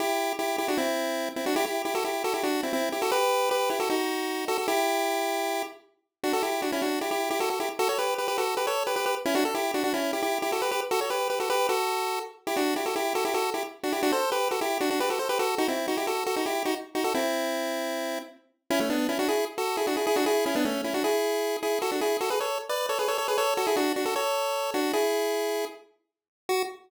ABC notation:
X:1
M:4/4
L:1/16
Q:1/4=154
K:Em
V:1 name="Lead 1 (square)"
[EG]4 [EG]2 [EG] [DF] [CE]6 [CE] [DF] | [EG] [EG]2 [EG] [FA] [EG]2 [FA] [EG] [DF]2 [CE] [CE]2 [EG] [FA] | [GB]4 [GB]2 [EG] [FA] [^DF]6 [FA] [FA] | [EG]10 z6 |
[K:Bm] [DF] [FA] [EG]2 [DF] [CE] [DF]2 [EG] [EG]2 [EG] [FA] [FA] [EG] z | [FA] [Ac] [GB]2 [GB] [GB] [FA]2 [GB] [Ac]2 [GB] [GB] [GB] z [CE] | [DF] A [EG]2 [DF] [DF] [CE]2 [EG] [EG]2 [EG] [FA] [GB] [GB] z | [FA] [Ac] [GB]2 [GB] [FA] [GB]2 [FA]6 z2 |
[K:Em] [EG] [DF]2 [EG] [FA] [EG]2 [FA] [EG] [FA]2 [EG] z2 [DF] [EG] | [DF] [Ac]2 [GB]2 [FA] [EG]2 [DF] [DF] [GB] [FA] [Ac] [GB] [FA]2 | [^DF] [CE]2 [DF] [EG] [FA]2 [FA] [DF] [EG]2 [DF] z2 [DF] [FA] | [CE]12 z4 |
[K:F#m] [CE] [A,C] [B,D]2 [CE] [DF] [EG]2 z [FA]2 [EG] [DF] [EG] [EG] [DF] | [EG]2 [CE] [B,D] [A,C]2 [CE] [DF] [EG]6 [EG]2 | [FA] [DF] [EG]2 [FA] [GB] [Ac]2 z [Bd]2 [Ac] [GB] [Ac] [Ac] [GB] | [Ac]2 [FA] [EG] [DF]2 [DF] [FA] [Ac]6 [DF]2 |
[EG]8 z8 | F4 z12 |]